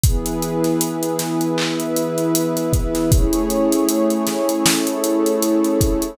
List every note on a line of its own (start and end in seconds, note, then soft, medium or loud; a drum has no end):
0.04 3.09 E3 medium
0.04 3.09 B3 loud
0.04 1.57 E4 medium
0.04 1.57 G#4 medium
0.04 3.09 G#4 loud
0.04 1.57 B4 medium
0.04 kick medium
0.04 closed hi-hat medium
0.26 closed hi-hat medium
0.42 closed hi-hat medium
0.64 snare soft
0.64 closed hi-hat medium
0.81 closed hi-hat medium
1.03 closed hi-hat medium
1.19 snare medium
1.19 closed hi-hat medium
1.41 closed hi-hat medium
1.58 3.10 E4 medium
1.58 3.10 B4 medium
1.58 3.10 E5 medium
1.58 clap medium
1.80 closed hi-hat medium
1.96 closed hi-hat medium
2.18 closed hi-hat medium
2.35 closed hi-hat loud
2.57 closed hi-hat medium
2.73 kick medium
2.73 closed hi-hat medium
2.95 snare soft
2.95 closed hi-hat medium
3.12 4.64 A3 medium
3.12 6.17 A3 medium
3.12 6.17 C#4 medium
3.12 4.64 E4 medium
3.12 6.17 E4 medium
3.12 4.64 G#4 medium
3.12 6.17 G#4 loud
3.12 4.64 C#5 medium
3.12 kick loud
3.12 closed hi-hat medium
3.33 closed hi-hat medium
3.50 closed hi-hat medium
3.72 closed hi-hat medium
3.89 closed hi-hat medium
4.10 closed hi-hat medium
4.27 snare medium
4.27 closed hi-hat medium
4.49 closed hi-hat medium
4.66 6.17 A3 medium
4.66 6.17 E4 medium
4.66 6.17 A4 medium
4.66 6.17 C#5 medium
4.66 snare loud
4.87 closed hi-hat medium
5.04 closed hi-hat medium
5.26 closed hi-hat medium
5.42 closed hi-hat medium
5.64 closed hi-hat medium
5.81 kick medium
5.81 closed hi-hat medium
6.02 closed hi-hat medium